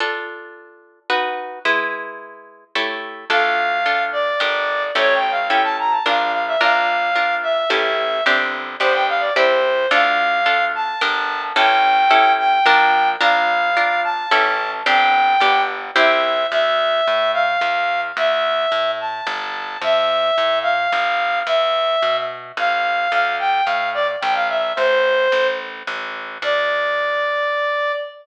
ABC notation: X:1
M:3/4
L:1/16
Q:1/4=109
K:Dm
V:1 name="Clarinet"
z12 | z12 | f6 d6 | (3^c2 g2 f2 g a b a f2 f e |
f6 e6 | z4 c g f d c4 | f6 a6 | g6 g6 |
f6 a6 | g6 z2 e4 | e6 f6 | e6 a6 |
e6 f6 | e6 z2 f4 | f2 g2 f2 d z g f e2 | c6 z6 |
d12 |]
V:2 name="Orchestral Harp"
[DFA]8 [^D^F=B]4 | [^G,E=B]8 [A,E=G^c]4 | [DFA]4 [DFA]4 [DGB]4 | [^CEGA]4 [CEGA]4 [DFB]4 |
[DFB]4 [DFB]4 [^CEGA]4 | [CDG]4 [=B,DG]4 [CEG]4 | [DFA]4 [DFA]4 [DGB]4 | [^CEGA]4 [CEGA]4 [DFB]4 |
[DFB]4 [DFB]4 [^CEGA]4 | [CDG]4 [=B,DG]4 [CEG]4 | z12 | z12 |
z12 | z12 | z12 | z12 |
z12 |]
V:3 name="Electric Bass (finger)" clef=bass
z12 | z12 | D,,8 G,,,4 | A,,,8 B,,,4 |
B,,,8 A,,,4 | G,,,4 G,,,4 C,,4 | D,,8 G,,,4 | A,,,8 B,,,4 |
B,,,8 A,,,4 | G,,,4 G,,,4 C,,4 | D,,4 A,,4 E,,4 | D,,4 A,,4 G,,,4 |
F,,4 A,,4 G,,,4 | E,,4 =B,,4 A,,,4 | D,,4 A,,4 B,,,4 | A,,,4 A,,,4 A,,,4 |
D,,12 |]